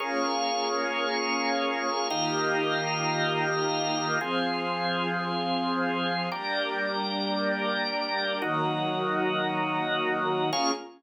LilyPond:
<<
  \new Staff \with { instrumentName = "String Ensemble 1" } { \time 4/4 \key bes \minor \tempo 4 = 114 <bes des' f' aes'>1 | <ees bes f' g'>1 | <f c' aes'>1 | <g bes d'>1 |
<ees ges bes>1 | <bes des' f' aes'>4 r2. | }
  \new Staff \with { instrumentName = "Drawbar Organ" } { \time 4/4 \key bes \minor <bes aes' des'' f''>1 | <ees' g' bes' f''>1 | <f' aes' c''>1 | <g' bes' d''>1 |
<ees' ges' bes'>1 | <bes aes' des'' f''>4 r2. | }
>>